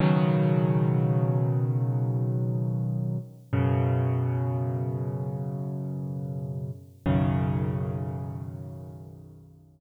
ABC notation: X:1
M:4/4
L:1/8
Q:1/4=68
K:B
V:1 name="Acoustic Grand Piano" clef=bass
[B,,C,D,F,]8 | [F,,B,,C,]8 | [B,,,F,,C,D,]8 |]